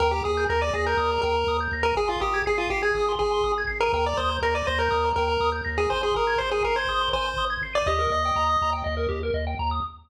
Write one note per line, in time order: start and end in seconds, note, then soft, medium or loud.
0.00 0.21 D#2 loud
0.00 0.11 A#4 medium
0.00 0.11 G5 loud
0.11 0.23 G4 medium
0.11 0.23 A#5 medium
0.24 0.46 D#2 medium
0.24 0.45 G#4 medium
0.24 0.35 D#6 loud
0.37 0.48 G6 loud
0.49 0.70 D#2 loud
0.49 0.62 A#4 medium
0.49 0.60 A#6 medium
0.61 0.73 D5 medium
0.61 0.72 D#7 loud
0.73 0.95 D#2 medium
0.73 0.85 G#4 medium
0.73 0.86 A#6 medium
0.86 1.21 A#4 medium
0.86 0.98 G6 medium
0.97 1.18 D#2 medium
0.97 1.09 D#6 loud
1.12 1.23 A#5 medium
1.22 1.44 D#2 medium
1.22 1.57 A#4 medium
1.22 1.34 G5 medium
1.37 1.48 A#5 medium
1.47 1.68 D#2 medium
1.47 1.59 D#6 loud
1.60 1.72 G6 loud
1.72 1.93 D#2 medium
1.72 1.84 A#6 medium
1.83 1.95 A#4 medium
1.83 1.96 D#7 loud
1.96 2.16 G#1 loud
1.96 2.09 G#4 loud
1.96 2.07 G#5 loud
2.08 2.21 F4 medium
2.08 2.19 C6 medium
2.21 2.42 G#1 medium
2.21 2.43 G4 medium
2.21 2.32 D#6 medium
2.34 2.45 G#6 medium
2.46 2.68 G#1 medium
2.46 2.59 G#4 medium
2.46 2.57 C7 loud
2.58 2.69 F4 medium
2.58 2.69 D#7 medium
2.70 2.91 G#1 medium
2.70 2.82 G4 medium
2.70 2.82 C7 medium
2.82 3.12 G#4 medium
2.82 2.93 G#6 loud
2.95 3.16 G#1 medium
2.95 3.06 D#6 medium
3.09 3.20 C6 medium
3.19 3.41 G#1 medium
3.19 3.52 G#4 medium
3.19 3.31 G#5 loud
3.31 3.42 C6 medium
3.44 3.65 G#1 medium
3.44 3.55 D#6 medium
3.58 3.69 G#6 medium
3.67 3.89 G#1 medium
3.67 3.78 C7 medium
3.81 3.92 A#4 medium
3.81 3.92 D#7 medium
3.93 4.14 D#2 medium
3.93 4.05 A#4 medium
3.93 4.05 G5 loud
4.05 4.18 D5 medium
4.05 4.16 A#5 loud
4.17 4.39 D#2 medium
4.17 4.37 C5 medium
4.17 4.28 D#6 medium
4.30 4.41 G6 loud
4.42 4.62 D#2 medium
4.42 4.54 A#4 medium
4.42 4.54 A#6 loud
4.54 4.66 D5 medium
4.54 4.65 D#7 loud
4.67 4.89 D#2 medium
4.67 4.79 C5 medium
4.67 4.78 A#6 medium
4.79 5.10 A#4 medium
4.79 4.90 G6 medium
4.90 5.13 D#2 medium
4.90 5.02 D#6 loud
5.05 5.16 A#5 loud
5.16 5.37 D#2 medium
5.16 5.50 A#4 medium
5.16 5.29 G5 medium
5.30 5.41 A#5 medium
5.40 5.61 D#2 medium
5.40 5.52 D#6 loud
5.52 5.63 G6 medium
5.65 5.87 D#2 medium
5.65 5.76 A#6 loud
5.78 5.89 G#4 medium
5.78 5.90 D#7 medium
5.90 6.12 G#1 medium
5.90 6.02 C5 medium
5.90 6.01 G#5 loud
6.03 6.15 G#4 medium
6.03 6.15 C6 medium
6.15 6.36 G#1 medium
6.15 6.39 A#4 medium
6.15 6.26 D#6 medium
6.27 6.38 G#6 medium
6.38 6.61 G#1 medium
6.38 6.50 C5 medium
6.38 6.49 C7 loud
6.51 6.63 G#4 medium
6.51 6.63 D#7 medium
6.63 6.85 G#1 medium
6.63 6.76 A#4 medium
6.63 6.74 C7 medium
6.76 7.09 C5 medium
6.76 6.87 G#6 medium
6.87 7.08 G#1 medium
6.87 7.00 D#6 loud
7.01 7.12 C6 medium
7.13 7.34 G#1 medium
7.13 7.45 C5 medium
7.13 7.25 G#5 medium
7.27 7.38 C6 medium
7.37 7.57 G#1 medium
7.37 7.49 D#6 loud
7.50 7.61 G#6 medium
7.61 7.82 G#1 medium
7.61 7.74 C7 medium
7.73 7.87 D5 medium
7.73 7.84 D#7 loud
7.86 8.07 D#2 loud
7.86 7.99 G4 loud
7.86 8.70 D#5 medium
7.99 8.10 A#4 medium
8.10 8.31 D#2 medium
8.10 8.23 D#5 medium
8.25 8.36 G5 medium
8.36 8.57 D#2 medium
8.36 8.47 A#5 loud
8.47 8.58 D#6 medium
8.61 8.82 D#2 medium
8.61 8.73 A#5 loud
8.73 8.84 G5 loud
8.84 9.07 D#2 medium
8.84 8.95 D#5 loud
8.97 9.08 A#4 medium
9.09 9.30 D#2 medium
9.09 9.20 G4 loud
9.23 9.34 A#4 loud
9.34 9.55 D#2 medium
9.34 9.45 D#5 medium
9.47 9.58 G5 medium
9.59 9.80 D#2 medium
9.59 9.70 A#5 loud
9.71 9.82 D#6 medium